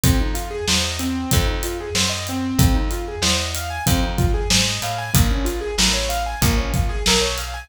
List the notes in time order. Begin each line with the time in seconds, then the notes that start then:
0.03 F2 C4, kick, closed hi-hat
0.20 D#4
0.34 F4, closed hi-hat
0.51 G#4
0.68 E2 C5, snare
0.84 D#5
0.99 C4, closed hi-hat
1.31 F2, kick, closed hi-hat
1.47 D#4
1.63 F4, closed hi-hat
1.80 G#4
1.95 F#2 C5, snare
2.09 D#5
2.27 C4, closed hi-hat
2.59 F2, kick, closed hi-hat
2.75 D#4
2.91 F4, closed hi-hat
3.08 G#4
3.22 E2 C5, snare
3.37 D#5
3.55 F5, closed hi-hat
3.70 G#5
3.86 F2 C4, kick, closed hi-hat
4.03 D#4
4.18 F4, kick, closed hi-hat
4.34 G#4
4.50 G#2 C5, snare
4.67 D#5
4.82 A2 F5, closed hi-hat
4.98 G#5
5.14 A#1 A#3, kick, closed hi-hat
5.31 C#4
5.45 F4, closed hi-hat
5.61 G#4
5.78 A1 A#4, snare
5.93 C#5
6.09 F5, closed hi-hat
6.26 G#5
6.41 A#1 A#3, kick, closed hi-hat
6.57 C#4
6.74 F4, kick, closed hi-hat
6.89 G#4
7.06 B1 A#4, snare
7.21 C#5
7.38 F5, closed hi-hat
7.54 G#5